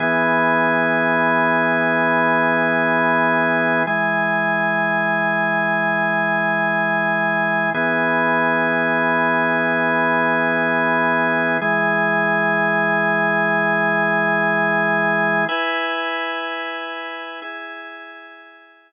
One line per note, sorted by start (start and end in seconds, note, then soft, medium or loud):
0.00 3.83 E3 medium
0.00 3.83 B3 medium
0.00 3.83 G#4 medium
3.87 7.70 E3 medium
3.87 7.70 G#3 medium
3.87 7.70 G#4 medium
7.74 11.57 E3 medium
7.74 11.57 B3 medium
7.74 11.57 G#4 medium
11.61 15.45 E3 medium
11.61 15.45 G#3 medium
11.61 15.45 G#4 medium
15.49 17.40 E4 medium
15.49 17.40 B4 medium
15.49 17.40 G#5 medium
17.42 18.92 E4 medium
17.42 18.92 G#4 medium
17.42 18.92 G#5 medium